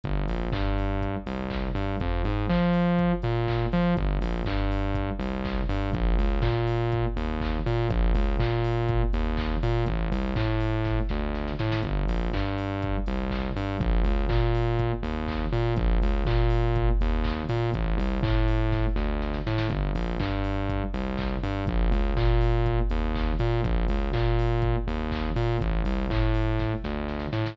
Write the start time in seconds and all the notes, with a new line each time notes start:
0.04 G1, kick, closed hi-hat
0.28 A#1, open hi-hat
0.52 G2, kick, clap
0.78 open hi-hat
1.01 kick, closed hi-hat
1.26 C2, open hi-hat
1.50 kick, clap
1.75 G2, open hi-hat
2.00 F2, kick, closed hi-hat
2.24 G#2, open hi-hat
2.49 F3, kick, clap
2.73 open hi-hat
2.99 kick, closed hi-hat
3.22 A#2, open hi-hat
3.48 kick, clap
3.72 F3, open hi-hat
3.97 G1, kick, closed hi-hat
4.21 A#1, open hi-hat
4.45 G2, kick, clap
4.71 open hi-hat
4.94 kick, closed hi-hat
5.19 C2, open hi-hat
5.45 kick, clap
5.69 G2, open hi-hat
5.93 A#1, kick, closed hi-hat
6.18 C#2, open hi-hat
6.42 A#2, kick, clap
6.67 open hi-hat
6.92 kick, closed hi-hat
7.16 D#2, open hi-hat
7.41 kick, clap
7.66 A#2, open hi-hat
7.90 A#1, kick, closed hi-hat
8.14 C#2, open hi-hat
8.40 A#2, kick, clap
8.64 open hi-hat
8.88 kick, closed hi-hat
9.13 D#2, open hi-hat
9.37 kick, clap
9.63 A#2, open hi-hat
9.86 A1, kick, closed hi-hat
10.12 C2, open hi-hat
10.36 A2, kick, clap
10.60 open hi-hat
10.85 kick, snare
11.09 D2, snare
11.35 snare
11.48 snare
11.59 A2, snare
11.72 snare
11.83 G1, kick, closed hi-hat
12.08 A#1, open hi-hat
12.33 G2, kick, clap
12.58 open hi-hat
12.82 kick, closed hi-hat
13.06 C2, open hi-hat
13.30 kick, clap
13.56 G2, open hi-hat
13.80 A#1, kick, closed hi-hat
14.04 C#2, open hi-hat
14.29 A#2, kick, clap
14.55 open hi-hat
14.79 kick, closed hi-hat
15.03 D#2, open hi-hat
15.28 kick, clap
15.53 A#2, open hi-hat
15.76 A#1, kick, closed hi-hat
16.02 C#2, open hi-hat
16.26 A#2, kick, clap
16.50 open hi-hat
16.76 kick, closed hi-hat
17.01 D#2, open hi-hat
17.24 kick, clap
17.49 A#2, open hi-hat
17.73 A1, kick, closed hi-hat
17.98 C2, open hi-hat
18.23 A2, kick, clap
18.48 open hi-hat
18.72 kick, snare
18.96 D2, snare
19.22 snare
19.34 snare
19.46 A2, snare
19.58 snare
19.70 G1, kick, closed hi-hat
19.95 A#1, open hi-hat
20.20 G2, kick, clap
20.44 open hi-hat
20.69 kick, closed hi-hat
20.94 C2, open hi-hat
21.18 kick, clap
21.43 G2, open hi-hat
21.67 A#1, kick, closed hi-hat
21.92 C#2, open hi-hat
22.16 A#2, kick, clap
22.41 open hi-hat
22.66 kick, closed hi-hat
22.90 D#2, open hi-hat
23.15 kick, clap
23.39 A#2, open hi-hat
23.64 A#1, kick, closed hi-hat
23.88 C#2, open hi-hat
24.13 A#2, kick, clap
24.39 open hi-hat
24.62 kick, closed hi-hat
24.87 D#2, open hi-hat
25.11 kick, clap
25.36 A#2, open hi-hat
25.61 A1, kick, closed hi-hat
25.85 C2, open hi-hat
26.10 A2, kick, clap
26.34 open hi-hat
26.59 kick, snare
26.84 D2, snare
27.08 snare
27.20 snare
27.33 A2, snare
27.46 snare